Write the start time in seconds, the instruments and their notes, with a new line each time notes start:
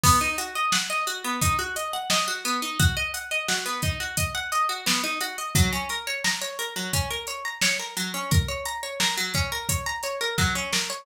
0.03 pizzicato strings B3, kick, crash
0.21 pizzicato strings D#4
0.38 pizzicato strings F#4, closed hi-hat
0.55 pizzicato strings D#5
0.72 pizzicato strings F#5, snare
0.90 pizzicato strings D#5
1.07 pizzicato strings F#4, closed hi-hat
1.24 pizzicato strings B3
1.41 pizzicato strings D#4, kick, closed hi-hat
1.59 pizzicato strings F#4
1.76 pizzicato strings D#5, closed hi-hat
1.93 pizzicato strings F#5
2.10 pizzicato strings D#5, snare
2.28 pizzicato strings F#4
2.45 pizzicato strings B3, closed hi-hat
2.62 pizzicato strings D#4
2.79 pizzicato strings F#4, kick, closed hi-hat
2.97 pizzicato strings D#5
3.14 pizzicato strings F#5, closed hi-hat
3.31 pizzicato strings D#5
3.48 pizzicato strings F#4, snare
3.66 pizzicato strings B3
3.82 pizzicato strings D#4, kick, closed hi-hat
4.00 pizzicato strings F#4
4.17 pizzicato strings D#5, kick, closed hi-hat
4.35 pizzicato strings F#5
4.52 pizzicato strings D#5, closed hi-hat
4.69 pizzicato strings F#4
4.86 pizzicato strings B3, snare
5.04 pizzicato strings D#4
5.21 pizzicato strings F#4, closed hi-hat
5.38 pizzicato strings D#5
5.55 pizzicato strings F#3, kick, closed hi-hat
5.73 pizzicato strings C#4
5.89 pizzicato strings A#4, closed hi-hat
6.07 pizzicato strings C#5
6.24 pizzicato strings A#5, snare
6.42 pizzicato strings C#5
6.59 pizzicato strings A#4, closed hi-hat
6.76 pizzicato strings F#3
6.93 pizzicato strings C#4, kick, closed hi-hat
7.10 pizzicato strings A#4
7.27 pizzicato strings C#5, closed hi-hat
7.45 pizzicato strings A#5
7.61 pizzicato strings C#5, snare
7.79 pizzicato strings A#4
7.97 pizzicato strings F#3, closed hi-hat
8.14 pizzicato strings C#4
8.31 pizzicato strings A#4, kick, closed hi-hat
8.48 pizzicato strings C#5
8.65 pizzicato strings A#5, closed hi-hat
8.83 pizzicato strings C#5
9.00 pizzicato strings A#4, snare
9.17 pizzicato strings F#3
9.34 pizzicato strings C#4, kick, closed hi-hat
9.52 pizzicato strings A#4
9.69 pizzicato strings C#5, kick, closed hi-hat
9.86 pizzicato strings A#5
10.03 pizzicato strings C#5, closed hi-hat
10.21 pizzicato strings A#4
10.38 pizzicato strings F#3, kick, snare
10.55 pizzicato strings C#4
10.73 pizzicato strings A#4, snare
10.90 pizzicato strings C#5